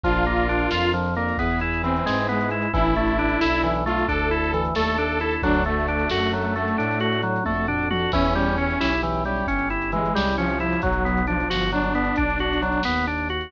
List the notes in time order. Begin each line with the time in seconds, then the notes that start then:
0.03 A#1 F3 D4 F4 A#4, kick, closed hi-hat
0.13 closed hi-hat
0.25 A#3, closed hi-hat
0.37 closed hi-hat
0.49 D4, closed hi-hat
0.59 closed hi-hat
0.71 F2 F4, snare
0.83 closed hi-hat
0.93 F3, closed hi-hat
1.05 closed hi-hat
1.15 A#3 D4 F4 A#4, closed hi-hat
1.29 closed hi-hat
1.38 E2 B3 E4 G#4 B4, kick, closed hi-hat
1.51 closed hi-hat
1.60 E4, closed hi-hat
1.74 closed hi-hat
1.83 E3 C4, closed hi-hat
1.96 closed hi-hat
2.06 G#2 G#3, snare
2.17 closed hi-hat
2.29 G#3 B3, closed hi-hat
2.41 closed hi-hat
2.50 E4, closed hi-hat
2.62 closed hi-hat
2.73 A1 E3 D4 E4 A4, kick, closed hi-hat
2.85 closed hi-hat
2.95 A3 D4 E4 A4, closed hi-hat
3.07 closed hi-hat
3.19 D4, closed hi-hat
3.29 closed hi-hat
3.41 B1 D4 E4 A4, snare
3.53 closed hi-hat
3.63 E3, closed hi-hat
3.75 closed hi-hat
3.86 A3 D4 E4 F4 A4, closed hi-hat
3.98 closed hi-hat
4.08 D2 D4 A4, kick, closed hi-hat
4.19 closed hi-hat
4.31 E4, closed hi-hat
4.44 closed hi-hat
4.53 E3, closed hi-hat
4.65 closed hi-hat
4.75 D#2 A3 D4 E4 A4, snare
4.88 closed hi-hat
4.97 D4, closed hi-hat
5.10 closed hi-hat
5.20 D4 E4 A4, closed hi-hat
5.31 closed hi-hat
5.42 D2 F#3 D4 F#4 A4, kick, closed hi-hat
5.54 closed hi-hat
5.64 A3 D4 F#4 A4, closed hi-hat
5.79 closed hi-hat
5.88 D4, closed hi-hat
5.99 closed hi-hat
6.10 F#2 D4 F#4 A4, snare
6.21 closed hi-hat
6.33 F#3, closed hi-hat
6.44 closed hi-hat
6.56 A3 D4 F#4 A4, closed hi-hat
6.68 closed hi-hat
6.78 A2 D4, closed hi-hat
6.91 closed hi-hat
7.00 F#4, closed hi-hat
7.12 closed hi-hat
7.22 F#3, closed hi-hat
7.36 closed hi-hat
7.44 F2 A3 D4 F#4 A4, kick, high tom
7.68 D4, floor tom
7.90 D4 F#4 A4, mid tom
8.12 E2 E3 C#4 E4 G4, kick, crash
8.25 closed hi-hat
8.35 G3 C#4 E4 G4, closed hi-hat
8.47 closed hi-hat
8.57 C#4, closed hi-hat
8.70 closed hi-hat
8.80 B1 C#4 E4 G4, snare
8.93 closed hi-hat
9.03 E3, closed hi-hat
9.14 closed hi-hat
9.25 G3 C#4 E4 G4, closed hi-hat
9.36 closed hi-hat
9.47 G1 C#4, kick, closed hi-hat
9.59 closed hi-hat
9.70 E4, closed hi-hat
9.82 closed hi-hat
9.92 E3 G#3, closed hi-hat
10.05 closed hi-hat
10.14 C2 G3 C#4 E4 G4, snare
10.26 closed hi-hat
10.37 F3 C#4, closed hi-hat
10.49 closed hi-hat
10.60 C#4 E4 G4, closed hi-hat
10.72 closed hi-hat
10.82 B1 F#3, kick, closed hi-hat
10.92 closed hi-hat
11.05 B3, closed hi-hat
11.17 closed hi-hat
11.27 F3 D4, closed hi-hat
11.40 closed hi-hat
11.50 G1 F#4, snare
11.60 closed hi-hat
11.72 F#3 D4, closed hi-hat
11.83 closed hi-hat
11.95 B3, closed hi-hat
12.04 closed hi-hat
12.16 B1 D4, kick, closed hi-hat
12.30 closed hi-hat
12.39 F#4, closed hi-hat
12.53 closed hi-hat
12.62 F#3, closed hi-hat
12.72 closed hi-hat
12.83 D#2 B3, snare
12.97 closed hi-hat
13.07 D4, closed hi-hat
13.18 closed hi-hat
13.29 F#4, closed hi-hat
13.41 closed hi-hat